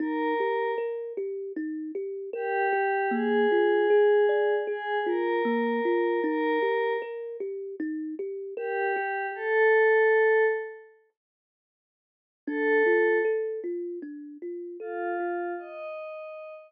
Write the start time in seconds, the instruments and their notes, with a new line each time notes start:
0.00 kalimba D#4, pad 5 (bowed) A#4
0.40 kalimba G4
0.78 kalimba A#4
1.17 kalimba G4
1.56 kalimba D#4
1.95 kalimba G4
2.33 pad 5 (bowed) G4, kalimba A#4
2.73 kalimba G4
3.11 kalimba A#3, pad 5 (bowed) G#4
3.52 kalimba F4
3.90 kalimba G#4
4.29 kalimba D5
4.67 pad 5 (bowed) G#4, kalimba G#4
5.06 kalimba F4, pad 5 (bowed) A#4
5.45 kalimba A#3
5.85 kalimba F4
6.23 kalimba D#4, pad 5 (bowed) A#4
6.62 kalimba G4
7.02 kalimba A#4
7.40 kalimba G4
7.80 kalimba D#4
8.19 kalimba G4
8.57 pad 5 (bowed) G4, kalimba A#4
8.96 kalimba G4
9.35 pad 5 (bowed) A4
12.47 kalimba D4, pad 5 (bowed) A4
12.86 kalimba F4
13.25 kalimba A4
13.64 kalimba F4
14.02 kalimba D4
14.42 kalimba F4
14.80 pad 5 (bowed) F4, kalimba A4
15.20 kalimba F4
15.58 pad 5 (bowed) D#5